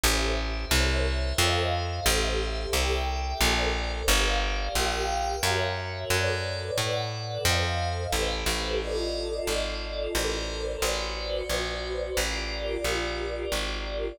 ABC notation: X:1
M:3/4
L:1/8
Q:1/4=89
K:Aphr
V:1 name="Pad 5 (bowed)"
[GAce]2 [Bc_de]2 [Ac_ef]2 | [GAce]2 [GAeg]2 [ABcd]2 | [GBdf]2 [GBfg]2 [^F^A^ce]2 | [A=B^cd]2 [ABd^f]2 [A=c_e=f]2 |
[GA=Bc]2 [FAd_e]4 | [ABcd]2 [^F=Bcd]4 | [FGBd]6 |]
V:2 name="Electric Bass (finger)" clef=bass
A,,,2 C,,2 F,,2 | A,,,2 C,,2 B,,,2 | G,,,2 B,,,2 ^F,,2 | ^F,,2 A,,2 =F,,2 |
A,,, A,,,3 ^G,,,2 | A,,,2 A,,,2 B,,,2 | A,,,2 B,,,2 ^G,,,2 |]